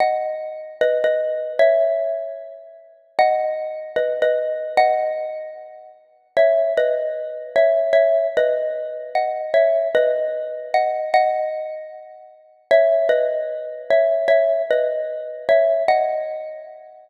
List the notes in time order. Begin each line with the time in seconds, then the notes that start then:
0.00 D#5 F#5
0.81 B4 D#5
1.04 B4 D#5
1.59 C#5 E5
3.19 D#5 F#5
3.96 B4 D#5
4.22 B4 D#5
4.77 D#5 F#5
6.37 C#5 E5
6.77 B4 D#5
7.56 C#5 E5
7.93 C#5 E5
8.37 B4 D#5
9.15 D#5 F#5
9.54 C#5 E5
9.95 B4 D#5
10.74 D#5 F#5
11.14 D#5 F#5
12.71 C#5 E5
13.09 B4 D#5
13.90 C#5 E5
14.28 C#5 E5
14.71 B4 D#5
15.49 C#5 E5
15.88 D#5 F#5